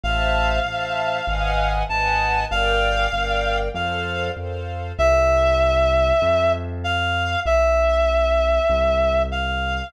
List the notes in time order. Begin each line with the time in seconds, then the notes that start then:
0.03 A1 C5 E5 F5 A5
0.65 A1 C5 E5 A5
1.27 G#1 B4 D#5 F#5 G#5
1.89 G#1 B4 D#5 F#5 G#5 A5
2.51 G1 A#4 D5 F5 G5
3.13 G1 A#4 D5 G5
3.74 F2 A4 C5 F5
4.36 F2 A4 C5 F5
4.98 C2 E5
6.22 F2
6.84 F5
7.46 B1 E5
8.70 C2
9.31 F5